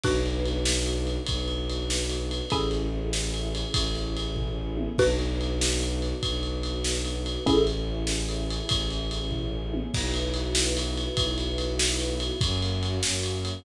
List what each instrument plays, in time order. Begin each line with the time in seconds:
0.04 violin B1, string ensemble 1 B3 D4 F#4, xylophone D4 F#4 B4, kick, crash
0.26 ride
0.46 ride
0.65 snare
0.86 ride
1.07 ride
1.27 violin B1, kick, ride
1.48 ride
1.70 ride
1.90 snare
2.09 ride
2.31 ride
2.50 violin A1, string ensemble 1 A3 C#4 E4 G#4, xylophone C#4 E4 G#4 A4, kick, ride
2.71 ride
3.13 snare
3.34 ride
3.55 ride
3.74 violin A1, kick, ride
3.95 ride
4.17 ride
4.36 kick, floor tom
4.77 high tom
4.98 violin B1, string ensemble 1 B3 D4 F#4, xylophone D4 F#4 B4, kick, crash
5.19 ride
5.41 ride
5.61 snare
5.80 ride
6.02 ride
6.23 violin B1, kick, ride
6.43 ride
6.63 ride
6.84 snare
7.05 ride
7.26 ride
7.46 violin A1, string ensemble 1 A3 C#4 E4 G#4, xylophone C#4 E4 G#4 A4, kick, ride
7.67 ride
8.07 snare
8.29 ride
8.51 ride
8.69 violin A1, kick, ride
8.90 ride
9.11 ride
9.31 kick, floor tom
9.74 high tom
9.94 violin B1, string ensemble 1 B3 E4 F#4, kick, crash
10.14 ride
10.34 ride
10.55 snare
10.77 ride
10.98 ride
11.17 violin B1, kick, ride
11.38 ride
11.58 ride
11.79 snare
11.99 ride
12.20 ride
12.41 violin F#2, string ensemble 1 A#3 C#4 F#4, kick, ride
12.62 ride
12.83 ride
13.03 violin F#2, snare
13.23 ride
13.45 ride